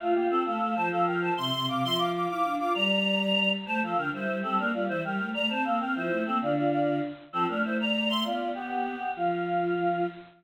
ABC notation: X:1
M:6/8
L:1/8
Q:3/8=131
K:F
V:1 name="Choir Aahs"
[A,F] [B,G] [CA] [Af]2 [ca] | [Af] [Bg] [ca] [ec']2 [fd'] | [ec'] [fd'] [fd'] [fd']2 [fd'] | [db]6 |
[ca] [Af] [Bg] [Ec]2 [CA] | [DB] [Fd] [Ec] [Bg]2 [db] | [ca] [Af] [Bg] [Ec]2 [CA] | [Fd] [Fd] [Fd]2 z2 |
[CA] [DB] [Ec] [db]2 [ec'] | [Fd]2 [=B,G]4 | F6 |]
V:2 name="Choir Aahs"
F3 A, A, F, | F,3 C, C, C, | F,3 E D F | G,6 |
A, F, D, G, G, G, | B, G, E, G, A, A, | C B, C F, A, B, | D,4 z2 |
F, A, A,4 | =B,5 z | F,6 |]